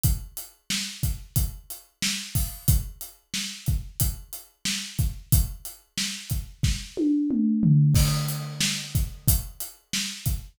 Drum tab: CC |--------|--------|--------|x-------|
HH |xx-xxx-o|xx-xxx-x|xx-x----|-x-xxx-x|
SD |--o---o-|--o---o-|--o-o---|--o---o-|
T1 |--------|--------|-----o--|--------|
T2 |--------|--------|------o-|--------|
FT |--------|--------|-------o|--------|
BD |o--oo--o|o--oo--o|o--oo---|o--oo--o|